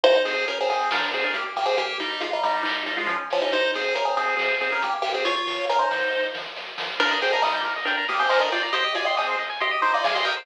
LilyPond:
<<
  \new Staff \with { instrumentName = "Lead 1 (square)" } { \time 4/4 \key aes \major \tempo 4 = 138 <ees' c''>8 <c' aes'>8 <des' bes'>16 <c' aes'>16 <c' aes'>8 <d' bes'>8 <c' aes'>16 <d' bes'>16 <bes g'>16 r16 <bes g'>16 <c' aes'>16 | <bes g'>8 <g ees'>8 <aes f'>16 <g ees'>16 <g ees'>8 <g ees'>8 <g ees'>16 <aes f'>16 <f des'>16 r16 <f des'>16 <g ees'>16 | <ees' c''>8 <c' aes'>8 <des' bes'>16 <c' aes'>16 <c' aes'>8 <c' aes'>8 <c' aes'>16 <des' bes'>16 <bes g'>16 r16 <bes g'>16 <c' aes'>16 | <f' des''>16 <f' des''>8. <des' bes'>16 <ees' c''>4~ <ees' c''>16 r4. |
\key ees \major <d' bes'>8 <c' aes'>16 <d' bes'>16 <g ees'>8 r8 <d' bes'>8 <bes g'>16 <c' aes'>16 <ees' c''>16 <d' bes'>16 <f' d''>16 r16 | <g' ees''>8 <f' d''>16 <g' ees''>16 <c' aes'>8 r8 <g' ees''>8 <ees' c''>16 <f' d''>16 <aes' f''>16 <g' ees''>16 <bes' g''>16 r16 | }
  \new Staff \with { instrumentName = "Lead 1 (square)" } { \time 4/4 \key aes \major r1 | r1 | r1 | r1 |
\key ees \major bes'16 ees''16 g''16 bes''16 ees'''16 g'''16 bes'16 ees''16 g''16 bes''16 ees'''16 g'''16 bes'16 ees''16 g''16 bes''16 | c''16 ees''16 aes''16 c'''16 ees'''16 c''16 ees''16 aes''16 c'''16 ees'''16 c''16 ees''16 aes''16 c'''16 ees'''16 c''16 | }
  \new Staff \with { instrumentName = "Synth Bass 1" } { \clef bass \time 4/4 \key aes \major aes,,8 aes,8 aes,,8 aes,8 bes,,8 bes,8 bes,,8 bes,8 | r1 | aes,,8 aes,8 aes,,8 aes,8 aes,,8 aes,8 aes,,8 aes,8 | ees,8 ees8 ees,8 ees8 ees,8 ees8 ees,8 ees8 |
\key ees \major ees,8 ees,8 ees,8 ees,8 ees,8 ees,8 ees,8 ees,8 | aes,,8 aes,,8 aes,,8 aes,,8 aes,,8 aes,,8 aes,,8 aes,,8 | }
  \new DrumStaff \with { instrumentName = "Drums" } \drummode { \time 4/4 bd8 hho8 <hh bd>8 hho8 <bd sn>8 hho8 <hh bd>8 hho8 | <hh bd>8 hho8 <hh bd>8 hho8 <hc bd>8 hho8 <hh bd>8 hho8 | <hh bd>8 hho8 <hh bd>8 hho8 <bd sn>8 hho8 <hh bd>8 hho8 | <hh bd>8 hho8 <hh bd>8 hho8 bd8 sn8 sn8 sn8 |
<cymc bd>8 hho8 <hc bd>8 hho8 <hh bd>8 hho8 <hc bd>8 hho8 | <hh bd>8 hho8 <hc bd>8 hho8 <hh bd>8 hho8 <bd sn>8 hho8 | }
>>